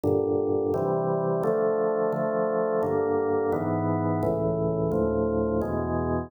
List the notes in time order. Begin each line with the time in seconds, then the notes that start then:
0.03 G2 A#2 D3
0.74 C3 E3 G3
1.43 D3 F3 A3
2.12 D3 F3 A3
2.83 G2 D3 A#3
3.52 G#2 E3 B3
4.23 C#2 A2 E3
4.91 D2 A2 F3
5.61 E2 B2 G#3